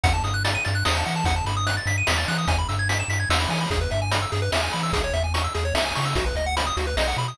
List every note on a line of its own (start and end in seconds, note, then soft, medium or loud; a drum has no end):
0.03 0.21 E2 medium
0.03 0.13 F#5 loud
0.03 kick loud
0.03 closed hi-hat medium
0.14 0.23 A5 medium
0.22 0.57 G2 medium
0.22 0.33 D#6 medium
0.22 closed hi-hat medium
0.34 0.43 F#6 medium
0.44 0.54 A6 medium
0.44 closed hi-hat medium
0.55 0.64 D#7 medium
0.65 0.84 G2 medium
0.65 0.74 A6 medium
0.65 closed hi-hat medium
0.75 0.84 F#6 medium
0.85 1.04 E2 medium
0.85 0.94 D#6 medium
0.85 snare medium
0.95 1.04 A5 medium
1.05 1.24 E3 medium
1.05 1.15 F#5 medium
1.05 closed hi-hat medium
1.16 1.25 A5 medium
1.24 1.42 E2 medium
1.24 1.35 F#5 loud
1.24 kick medium
1.24 closed hi-hat medium
1.36 1.45 A5 medium
1.45 1.80 G2 medium
1.45 1.56 B5 medium
1.45 closed hi-hat medium
1.57 1.66 D#6 medium
1.67 1.76 F#6 medium
1.67 closed hi-hat medium
1.77 1.86 A6 medium
1.86 2.03 G2 medium
1.86 1.96 B6 medium
1.86 closed hi-hat medium
1.98 2.07 D#7 medium
2.07 2.25 E2 medium
2.07 2.17 B6 medium
2.07 snare medium
2.18 2.27 A6 medium
2.28 2.46 E3 medium
2.28 2.37 F#6 medium
2.28 closed hi-hat medium
2.38 2.47 D#6 medium
2.47 2.65 E2 medium
2.47 2.58 G#5 loud
2.47 kick medium
2.47 closed hi-hat medium
2.58 2.68 B5 medium
2.69 3.03 G2 medium
2.69 2.78 E6 medium
2.69 closed hi-hat medium
2.79 2.88 G#6 medium
2.89 2.98 B6 medium
2.89 closed hi-hat medium
2.99 3.09 E7 medium
3.08 3.26 G2 medium
3.08 3.19 B6 medium
3.08 closed hi-hat medium
3.20 3.29 G#6 medium
3.30 3.47 E2 medium
3.30 3.39 E6 medium
3.30 snare medium
3.40 3.49 B5 medium
3.49 3.66 E3 medium
3.49 3.59 G#5 medium
3.49 open hi-hat medium
3.61 3.70 B5 medium
3.70 3.88 E2 medium
3.70 3.80 G#4 medium
3.70 kick medium
3.70 closed hi-hat medium
3.81 3.90 B4 medium
3.91 4.26 G2 medium
3.91 4.00 E5 medium
3.91 closed hi-hat soft
4.02 4.11 G#5 medium
4.11 4.21 B5 medium
4.11 closed hi-hat medium
4.22 4.31 E6 medium
4.32 4.50 G2 medium
4.32 4.41 G#4 medium
4.32 closed hi-hat medium
4.42 4.51 B4 medium
4.52 4.69 E2 medium
4.52 4.61 E5 medium
4.52 snare medium
4.63 4.72 G#5 medium
4.73 4.91 E3 medium
4.73 4.82 B5 medium
4.73 open hi-hat soft
4.83 4.92 E6 medium
4.93 5.10 C#2 medium
4.93 5.02 G#4 medium
4.93 kick medium
4.93 closed hi-hat medium
5.04 5.13 C#5 medium
5.13 5.48 E2 medium
5.13 5.23 E5 medium
5.13 closed hi-hat medium
5.24 5.33 G#5 medium
5.34 5.43 C#6 medium
5.34 closed hi-hat medium
5.44 5.53 E6 medium
5.54 5.72 E2 medium
5.54 5.64 G#4 medium
5.54 closed hi-hat medium
5.65 5.74 C#5 medium
5.74 5.91 C#2 medium
5.74 5.84 E5 medium
5.74 snare medium
5.85 5.94 G#5 medium
5.95 6.14 C#3 medium
5.95 6.05 C#6 medium
5.95 open hi-hat medium
6.05 6.15 E6 medium
6.15 6.33 B1 medium
6.15 6.25 F#4 medium
6.15 kick medium
6.15 closed hi-hat medium
6.26 6.35 B4 medium
6.35 6.70 D2 medium
6.35 6.45 D#5 medium
6.35 closed hi-hat soft
6.46 6.55 F#5 medium
6.57 6.66 B5 medium
6.57 closed hi-hat medium
6.67 6.76 D#6 medium
6.77 6.94 D2 medium
6.77 6.86 F#4 medium
6.77 closed hi-hat medium
6.87 6.96 B4 medium
6.97 7.14 B1 medium
6.97 7.07 D#5 medium
6.97 snare medium
7.08 7.17 F#5 medium
7.17 7.34 B2 medium
7.17 7.27 B5 medium
7.17 closed hi-hat soft
7.28 7.37 D#6 medium